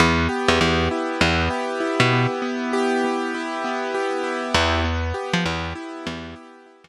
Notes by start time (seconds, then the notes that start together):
0.00 E2 B3
0.29 G4
0.48 E2
0.61 E2 B3
0.91 E4
1.21 E2 B3
1.50 G4
1.80 E4
2.00 B2
2.13 B3
2.42 B3
2.73 G4
3.04 B3
3.35 E4
3.64 B3
3.94 G4
4.24 E4
4.54 E2 B3
4.84 B3
5.14 G4
5.33 F3
5.46 E2 B3
5.75 E4
6.06 E2 B3
6.36 G4
6.66 E4
6.84 E2